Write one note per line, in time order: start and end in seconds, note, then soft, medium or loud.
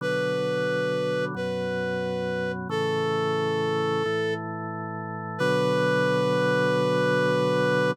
0.01 1.34 B2 medium
0.01 1.34 D3 medium
0.01 1.34 F#3 medium
0.01 1.25 B4 medium
1.35 2.68 F#2 medium
1.35 2.68 B2 medium
1.35 2.68 F#3 medium
1.35 2.52 B4 medium
2.69 4.03 A2 medium
2.69 4.03 C#3 medium
2.69 4.03 E3 medium
2.69 4.34 A4 medium
4.05 5.39 A2 medium
4.05 5.39 E3 medium
4.05 5.39 A3 medium
5.38 7.92 B2 loud
5.38 7.92 D3 loud
5.38 7.92 F#3 loud
5.38 7.91 B4 loud